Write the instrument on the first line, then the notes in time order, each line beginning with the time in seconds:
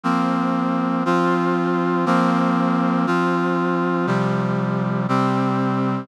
brass section
0.03 F3 A#3 C4
1.05 F3 C4 F4
2.06 F3 A#3 C4
3.07 F3 C4 F4
4.07 C3 F3 G3
5.08 C3 G3 C4